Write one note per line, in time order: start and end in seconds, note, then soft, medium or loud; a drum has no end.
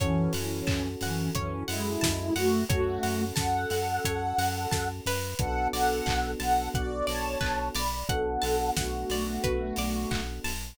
0.00 0.29 F#2 medium
0.00 0.33 E3 medium
0.00 0.33 C#4 medium
0.00 2.43 C#4 medium
0.00 2.43 F#4 medium
0.00 2.43 A4 medium
0.00 0.31 C#5 medium
0.00 kick medium
0.00 closed hi-hat loud
0.33 0.62 F#2 medium
0.33 0.88 E3 medium
0.33 0.88 C#4 medium
0.33 0.65 F#5 medium
0.33 open hi-hat medium
0.67 0.96 F#2 medium
0.67 0.97 A5 medium
0.67 kick medium
0.67 clap loud
1.01 1.30 F#2 medium
1.01 1.30 E3 medium
1.01 1.30 C#4 medium
1.01 1.33 F#5 medium
1.01 open hi-hat medium
1.35 1.64 F#2 medium
1.35 1.63 E3 medium
1.35 1.63 C#4 medium
1.35 1.66 C#5 medium
1.35 kick medium
1.35 closed hi-hat medium
1.68 1.97 F#2 medium
1.68 2.33 G#3 medium
1.68 2.33 E4 medium
1.68 1.98 F#5 medium
1.68 open hi-hat medium
2.01 2.31 F#2 medium
2.01 2.32 A5 medium
2.01 kick medium
2.01 snare loud
2.36 2.65 F#2 medium
2.36 2.64 A3 medium
2.36 2.64 F#4 medium
2.36 2.66 F#5 medium
2.36 open hi-hat medium
2.69 2.98 F#2 medium
2.69 3.24 A3 medium
2.69 5.12 C#4 medium
2.69 5.12 F#4 medium
2.69 3.24 F#4 medium
2.69 5.12 A4 medium
2.69 3.00 C#5 medium
2.69 kick loud
2.69 closed hi-hat medium
3.03 3.32 F#2 medium
3.03 3.33 F#5 medium
3.03 open hi-hat medium
3.36 3.66 F#2 medium
3.36 4.88 A4 medium
3.36 4.88 F#5 medium
3.36 3.66 A5 medium
3.36 kick medium
3.36 snare loud
3.70 3.99 F#2 medium
3.70 4.02 F#5 medium
3.70 open hi-hat medium
4.05 4.33 F#2 medium
4.05 4.36 C#5 medium
4.05 kick medium
4.05 closed hi-hat loud
4.38 4.67 F#2 medium
4.38 4.69 F#5 medium
4.38 open hi-hat medium
4.71 5.01 F#2 medium
4.71 5.02 A5 medium
4.71 kick medium
4.71 snare medium
5.06 5.34 F#2 medium
5.06 5.71 B4 medium
5.06 open hi-hat medium
5.39 5.68 B1 medium
5.39 7.82 B3 medium
5.39 7.82 D4 medium
5.39 7.82 F#4 loud
5.39 5.68 A4 medium
5.39 7.82 A4 medium
5.39 5.68 F#5 medium
5.39 kick medium
5.39 closed hi-hat medium
5.73 6.02 B1 medium
5.73 6.31 A4 medium
5.73 6.04 D5 medium
5.73 6.31 F#5 medium
5.73 open hi-hat medium
6.06 6.36 B1 medium
6.06 6.36 F#5 medium
6.06 kick medium
6.06 clap loud
6.40 6.69 B1 medium
6.40 6.69 A4 medium
6.40 6.69 F#5 medium
6.40 6.70 A5 medium
6.40 open hi-hat medium
6.74 7.03 B1 medium
6.74 7.06 F#4 medium
6.74 7.06 D5 medium
6.74 7.05 F#5 medium
6.74 kick medium
6.74 closed hi-hat medium
7.07 7.37 B1 medium
7.07 7.68 C#5 medium
7.07 7.37 D5 medium
7.07 7.68 A5 medium
7.07 open hi-hat medium
7.41 7.70 B1 medium
7.41 7.71 B4 medium
7.41 kick medium
7.41 clap medium
7.75 8.04 B1 medium
7.75 8.08 D5 medium
7.75 8.06 D5 medium
7.75 8.08 B5 medium
7.75 open hi-hat medium
8.09 8.38 B1 medium
8.09 10.51 B3 medium
8.09 10.51 D4 medium
8.09 10.51 F#4 medium
8.09 8.70 A4 medium
8.09 10.51 A4 medium
8.09 8.70 F#5 medium
8.09 8.40 F#5 medium
8.09 kick medium
8.09 closed hi-hat medium
8.42 8.71 B1 medium
8.42 8.72 A5 medium
8.42 open hi-hat medium
8.76 9.05 B1 medium
8.76 10.22 A3 medium
8.76 10.22 F#4 medium
8.76 9.07 F#5 medium
8.76 kick medium
8.76 snare loud
9.10 9.39 B1 medium
9.10 9.42 D5 medium
9.10 open hi-hat medium
9.44 9.72 B1 medium
9.44 9.74 B4 medium
9.44 kick medium
9.44 closed hi-hat medium
9.76 10.06 B1 medium
9.76 10.09 D5 medium
9.76 open hi-hat medium
10.11 10.40 B1 medium
10.11 10.41 F#5 medium
10.11 kick medium
10.11 clap loud
10.44 10.74 B1 medium
10.44 10.75 A5 medium
10.44 open hi-hat medium